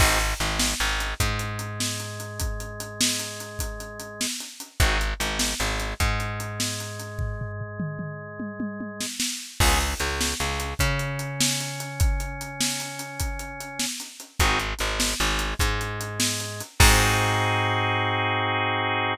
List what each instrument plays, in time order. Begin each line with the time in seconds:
0.00 electric bass (finger) G#1, drawbar organ C4 D#4 F#4 G#4, kick, crash
0.20 closed hi-hat
0.40 electric bass (finger) G#1, drawbar organ G#3, closed hi-hat
0.60 snare
0.80 electric bass (finger) G#1, drawbar organ G#3, closed hi-hat
1.00 closed hi-hat
1.20 electric bass (finger) G#2, drawbar organ G#3, kick, closed hi-hat
1.39 closed hi-hat
1.59 closed hi-hat
1.80 snare
2.00 closed hi-hat
2.20 closed hi-hat
2.40 kick, closed hi-hat
2.60 closed hi-hat
2.80 closed hi-hat
3.01 snare
3.19 closed hi-hat
3.40 closed hi-hat
3.59 kick, closed hi-hat
3.80 closed hi-hat
4.00 closed hi-hat
4.21 snare
4.40 closed hi-hat
4.60 closed hi-hat
4.80 electric bass (finger) G#1, drawbar organ C4 D#4 F#4 G#4, kick, closed hi-hat
5.01 closed hi-hat
5.20 electric bass (finger) G#1, drawbar organ G#3, closed hi-hat
5.39 snare
5.60 electric bass (finger) G#1, drawbar organ G#3, closed hi-hat
5.80 closed hi-hat
6.00 electric bass (finger) G#2, drawbar organ G#3, kick, closed hi-hat
6.20 closed hi-hat
6.40 closed hi-hat
6.60 snare
6.80 closed hi-hat
7.00 closed hi-hat
7.19 kick, floor tom
7.41 floor tom
7.61 floor tom
7.80 mid tom
7.99 mid tom
8.40 high tom
8.60 high tom
8.80 high tom
9.01 snare
9.20 snare
9.60 electric bass (finger) C#2, drawbar organ B3 C#4 F4 G#4, kick, crash
9.81 closed hi-hat
10.00 electric bass (finger) C#2, drawbar organ C#3, closed hi-hat
10.21 snare
10.40 electric bass (finger) C#2, drawbar organ C#3, closed hi-hat
10.60 closed hi-hat
10.79 electric bass (finger) C#3, drawbar organ C#4, kick, closed hi-hat
10.99 closed hi-hat
11.19 closed hi-hat
11.41 snare
11.60 closed hi-hat
11.80 closed hi-hat
12.00 kick, closed hi-hat
12.20 closed hi-hat
12.41 closed hi-hat
12.61 snare
12.80 closed hi-hat
12.99 closed hi-hat
13.20 kick, closed hi-hat
13.39 closed hi-hat
13.60 closed hi-hat
13.80 snare
14.00 closed hi-hat
14.20 closed hi-hat
14.40 electric bass (finger) G#1, drawbar organ C4 D#4 F#4 G#4, kick, closed hi-hat
14.60 closed hi-hat
14.79 electric bass (finger) G#1, drawbar organ G#3, closed hi-hat
15.00 snare
15.20 electric bass (finger) G#1, drawbar organ G#3, closed hi-hat
15.39 closed hi-hat
15.59 electric bass (finger) G#2, drawbar organ G#3, kick, closed hi-hat
15.81 closed hi-hat
16.01 closed hi-hat
16.20 snare
16.40 closed hi-hat
16.60 closed hi-hat
16.80 electric bass (finger) G#2, drawbar organ C4 D#4 F#4 G#4, kick, crash